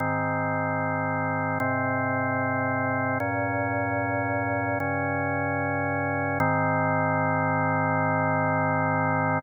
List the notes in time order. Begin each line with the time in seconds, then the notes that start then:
0.00 G#2 D#3 C4
1.60 G#2 C3 C4
3.20 G2 A#2 C#4
4.80 G2 C#3 C#4
6.40 G#2 D#3 C4